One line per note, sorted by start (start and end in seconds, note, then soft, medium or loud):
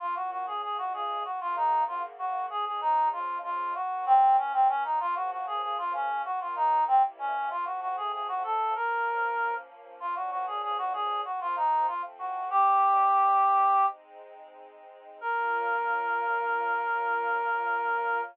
0.00 0.61 A#3 medium
0.00 0.61 C#4 medium
0.00 0.15 F4 loud
0.00 0.61 F4 medium
0.16 0.30 F#4 medium
0.31 0.46 F#4 medium
0.47 0.62 G#4 medium
0.62 1.23 C#3 medium
0.62 1.25 G#3 medium
0.62 1.25 F4 medium
0.62 0.77 G#4 medium
0.78 0.93 F#4 medium
0.94 1.23 G#4 medium
1.24 2.48 C#3 medium
1.24 2.48 A#3 medium
1.24 2.48 F#4 medium
1.24 1.40 F#4 medium
1.41 1.56 F4 loud
1.56 1.84 D#4 medium
1.88 2.02 F4 medium
2.19 2.46 F#4 medium
2.50 3.74 F3 medium
2.50 3.74 G#3 medium
2.50 3.74 C#4 medium
2.50 2.65 G#4 loud
2.66 2.81 G#4 medium
2.81 3.09 D#4 loud
3.12 3.38 F4 medium
3.43 3.74 F4 medium
3.75 4.99 F#3 medium
3.75 4.99 A#3 medium
3.75 4.99 C#4 medium
3.75 4.05 F#4 medium
4.06 4.37 C4 loud
4.37 4.52 C#4 medium
4.53 4.68 C4 medium
4.69 4.83 C#4 medium
4.84 4.99 D#4 medium
5.00 6.24 C#3 medium
5.00 6.24 F3 medium
5.00 6.24 A#3 medium
5.00 5.15 F4 loud
5.16 5.31 F#4 loud
5.31 5.46 F#4 medium
5.47 5.62 G#4 medium
5.63 5.77 G#4 medium
5.78 5.93 F4 loud
5.94 6.22 C#4 medium
6.25 6.87 D#3 medium
6.25 6.87 F#3 medium
6.25 6.87 A#3 medium
6.25 6.40 F#4 loud
6.41 6.56 F4 medium
6.56 6.84 D#4 loud
6.88 7.50 C3 medium
6.88 7.50 G3 medium
6.88 7.50 A#3 medium
6.88 7.02 C4 medium
6.88 7.50 E4 medium
7.19 7.49 C#4 medium
7.50 8.74 F3 medium
7.50 8.74 A3 medium
7.50 8.74 C4 medium
7.50 7.65 F4 medium
7.65 7.80 F#4 medium
7.81 7.96 F#4 medium
7.97 8.12 G#4 medium
8.12 8.27 G#4 medium
8.28 8.43 F#4 loud
8.44 8.74 A4 medium
8.75 9.99 F3 medium
8.75 9.99 A#3 medium
8.75 9.99 C#4 medium
8.75 9.54 A#4 loud
10.00 11.24 A#2 medium
10.00 11.24 F3 medium
10.00 11.24 C#4 medium
10.00 10.15 F4 medium
10.16 10.30 F#4 medium
10.31 10.46 F#4 medium
10.47 10.62 G#4 medium
10.62 10.77 G#4 loud
10.78 10.93 F#4 loud
10.93 11.21 G#4 loud
11.25 11.87 F3 medium
11.25 11.87 A#3 medium
11.25 11.87 C4 medium
11.25 11.40 F#4 medium
11.41 11.56 F4 loud
11.56 11.86 D#4 medium
11.87 12.50 F3 medium
11.87 12.50 A3 medium
11.87 12.50 C4 medium
11.87 12.02 F4 medium
12.19 12.49 F#4 medium
12.50 13.79 G3 medium
12.50 13.79 A#3 medium
12.50 13.79 D#4 medium
12.50 13.86 G4 loud
13.81 15.21 G#3 medium
13.81 15.21 C4 medium
13.81 15.21 D#4 medium
15.21 18.22 A#3 loud
15.21 18.22 C#4 loud
15.21 18.22 F4 loud
15.21 18.21 A#4 loud